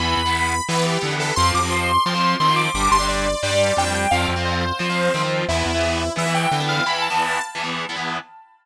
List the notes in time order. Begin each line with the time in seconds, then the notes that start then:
0.00 E2 E3 B3 B5
0.17 E2
0.26 E3 B3
0.68 E3 B3 B4
0.76 E3 B3
0.86 G4
1.01 D3 E3 B3
1.11 E3 B3
1.20 A4
1.36 F2 F3 C4 C6
1.54 F2 D6
1.63 F3 C4
1.71 C6
2.06 F3 C4 C6
2.15 F3 C4
2.40 D#3 F3 C4 C6
2.48 F3 C4
2.56 D6
2.74 G1 G3 D4 D6
2.91 G1 C6
2.99 G3 D4
3.08 D5
3.43 G2 G3 D4 D5
3.51 G3 D4
3.76 F2 G3 D4 G5
3.85 G3 D4
3.94 G5
4.11 F2 F3 C4 F5
4.29 F2
4.36 F3 C4
4.45 C5
4.79 F3 C4
4.90 F3 C4
5.14 D#3 F3 C4
5.23 F3 C4
5.48 E2 E3 B3 E4
5.66 E2
5.74 E3 B3
6.16 E3 B3 E5
6.26 E3 B3
6.34 G5
6.51 D3 E3 B3
6.60 E3 B3
6.69 F5
6.86 E3 B3 B5
7.02 A5
7.10 E3 B3
7.55 E3 B3
7.64 E3 B3
7.89 E3 B3
7.96 E3 B3